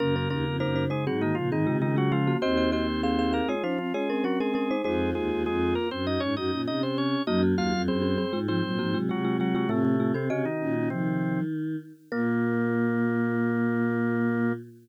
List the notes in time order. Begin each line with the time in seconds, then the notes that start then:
0.00 F#2 C#3 A#3 C#4 A#4
0.16 C#4 A#4
0.30 D#2 A#3 C#4 A#4
0.46 F2
0.60 F#2 A#3 D#4 A#4 C5
0.76 D#4 C5
0.90 G#3 D#4 G#4 C5
1.06 G#2 F#3 C4 F#4 G#4
1.21 D#3 A#3 D#4 F#4
1.35 A#2 C#3 F3 F4
1.51 G#2 D#3 C4 D#4 G#4
1.67 C3 C#3 G#3 F4
1.81 C#3 D#3 G#3 D#4 F4
1.96 F#3 G#3 F4 F#4
2.12 F3 G#3 F4
2.27 A#3 F#4
2.42 D#2 C4 F#4 C5 D#5
2.57 F#4 D#5
2.72 C4 F#4 C5 D#5
3.03 C4 G#4 C5 F5
3.19 G#4 F5
3.32 A#3 G#4 A#4 F5
3.48 G#3 F4 G#4 C#5
3.63 F3 C#4 D#4 F4 C5
3.78 F3 C4 F4
3.94 G#3 C#4 F4 G#4 C#5
4.09 C4 C#4 A#4
4.24 F#3 C#4 F#4 A#4
4.40 G#3 C#4 G#4 A#4
4.54 G#3 C#4 G#4 A#4
4.71 D#4 C5
4.84 F2 G#3 D#4 F4 G#4 C5
5.15 D#2 G#3 G#4
5.30 D#2
5.46 F2 G#3 G#4
5.75 A#3 A#4
5.91 F#2 C4 C5
6.06 D#4 F#4 D#5
6.20 G#2 C#4 C#5
6.36 F#2 D#4 F#4 D#5
6.52 A#2 C#4
6.67 C3 D#4 D#5
6.83 C4 C5
6.98 C#4 C#5
7.27 F#2 F#3 A#3 D#4 F#4 D#5
7.42 A#3 F#4
7.57 D#2 A#3 F4 F#4 F5
7.73 F2
7.88 F#2 C4 G#4 C5
8.02 C4 G#4
8.18 C4 G#4
8.33 G#2 G#3 F4
8.48 F3 G#3 C4 F4 C5
8.64 A#2 F#3
8.79 G#2 F3 A#3 F#4
8.94 C3 F#3 G#3 F4
9.09 C3 F#3 G#3 F4 F#4
9.24 G#3 F4
9.40 F#3 G#3 F4 F#4
9.55 F#3 G#3 F4 F#4
9.69 A2 C3 A3 C4 F4
9.85 A2 A3
10.00 A3 F4
10.14 C3 C4 A4
10.30 C3 C#3 C#4 F#4 D#5
10.45 D#3 D#4
10.60 A#2 C#4
10.76 C#4
10.90 C3 D#3 F3 C4
12.12 A#2 A#3 A#4